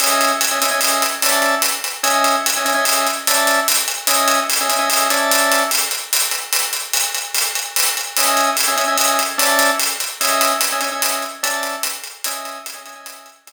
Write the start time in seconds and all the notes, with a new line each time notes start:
0.00 C#4 D#5 E5 G#5, closed hi-hat
0.21 closed hi-hat
0.41 closed hi-hat
0.51 C#4 D#5 E5 G#5
0.62 C#4 D#5 E5 G#5, closed hi-hat
0.71 C#4 D#5 E5 G#5
0.81 closed hi-hat
1.02 closed hi-hat
1.22 C#4 D5 E5 A5, closed hi-hat
1.42 closed hi-hat
1.62 closed hi-hat
1.84 closed hi-hat
2.03 C#4 D#5 E5 G#5, closed hi-hat
2.24 closed hi-hat
2.46 closed hi-hat
2.57 C#4 D#5 E5 G#5
2.65 C#4 D#5 E5 G#5, closed hi-hat
2.74 C#4 D#5 E5 G#5
2.85 closed hi-hat
3.07 closed hi-hat
3.27 C#4 D5 E5 A5, closed hi-hat
3.47 closed hi-hat
3.68 closed hi-hat
3.88 closed hi-hat
4.07 C#4 D#5 E5 G#5, closed hi-hat
4.28 closed hi-hat
4.50 closed hi-hat
4.61 C#4 D#5 E5 G#5
4.69 C#4 D#5 E5 G#5, closed hi-hat
4.79 C#4 D#5 E5 G#5
4.90 closed hi-hat
5.10 C#4 D5 E5 A5, closed hi-hat
5.31 closed hi-hat
5.52 closed hi-hat
5.71 closed hi-hat
5.91 closed hi-hat
6.13 closed hi-hat
6.31 closed hi-hat
6.53 closed hi-hat
6.73 closed hi-hat
6.93 closed hi-hat
7.15 closed hi-hat
7.35 closed hi-hat
7.55 closed hi-hat
7.76 closed hi-hat
7.97 closed hi-hat
8.17 C#4 D#5 E5 G#5, closed hi-hat
8.37 closed hi-hat
8.57 closed hi-hat
8.68 C#4 D#5 E5 G#5
8.77 C#4 D#5 E5 G#5, closed hi-hat
8.88 C#4 D#5 E5 G#5
8.98 closed hi-hat
9.19 closed hi-hat
9.38 C#4 D5 E5 A5, closed hi-hat
9.59 closed hi-hat
9.80 closed hi-hat
10.00 closed hi-hat
10.21 C#4 D#5 E5 G#5, closed hi-hat
10.41 closed hi-hat
10.61 closed hi-hat
10.72 C#4 D#5 E5 G#5
10.81 C#4 D#5 E5 G#5, closed hi-hat
10.92 C#4 D#5 E5 G#5
11.02 closed hi-hat
11.22 closed hi-hat
11.43 C#4 D5 E5 A5, closed hi-hat
11.63 closed hi-hat
11.83 closed hi-hat
12.04 closed hi-hat
12.24 C#4 D#5 E5 G#5, closed hi-hat
12.45 closed hi-hat
12.66 closed hi-hat
12.74 C#4 D#5 E5 G#5
12.86 C#4 D#5 E5 G#5, closed hi-hat
12.95 C#4 D#5 E5 G#5
13.06 closed hi-hat
13.26 closed hi-hat
13.47 C#4 D#5 E5 G#5, closed hi-hat